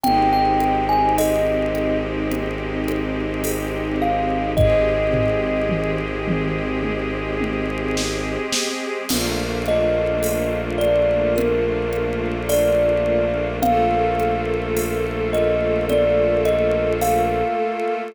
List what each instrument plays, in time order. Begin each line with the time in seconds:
0.04 violin G#1, string ensemble 1 G#3 C4 D#4 G4, kalimba G5, low conga
0.33 kalimba G5
0.60 high conga
0.89 kalimba G#5
1.18 kalimba D#5, tambourine, high conga
1.75 high conga
2.32 low conga
2.88 high conga
3.44 tambourine, high conga
4.02 kalimba F5
4.57 string ensemble 1 G#3 C4 G4 G#4, kalimba D#5, kick, floor tom
5.13 floor tom
5.69 mid tom
6.28 mid tom
6.83 high tom
7.41 high tom
7.97 snare
8.53 snare
9.09 violin A#1, string ensemble 1 A3 A#3 D4 F4, crash, low conga
9.66 kalimba D#5, high conga
10.23 tambourine, high conga
10.78 kalimba D5, high conga
11.36 kalimba A#4, low conga
11.93 high conga
12.49 kalimba D5, tambourine, high conga
13.62 string ensemble 1 A3 A#3 F4 A4, kalimba F5, low conga
14.20 high conga
14.77 tambourine, high conga
15.33 kalimba D#5, high conga
15.89 kalimba D5, low conga
16.46 kalimba D#5, high conga
17.01 kalimba F5, tambourine, high conga